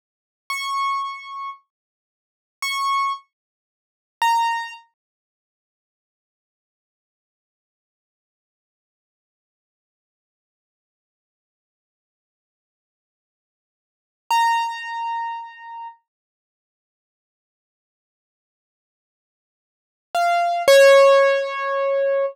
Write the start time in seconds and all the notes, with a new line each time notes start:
0.50 C#6
2.62 C#6
4.22 A#5
14.31 A#5
20.15 F5
20.68 C#5